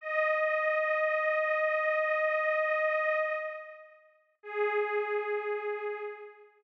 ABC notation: X:1
M:4/4
L:1/8
Q:1/4=54
K:G#phr
V:1 name="Pad 5 (bowed)"
d6 z2 | G3 z5 |]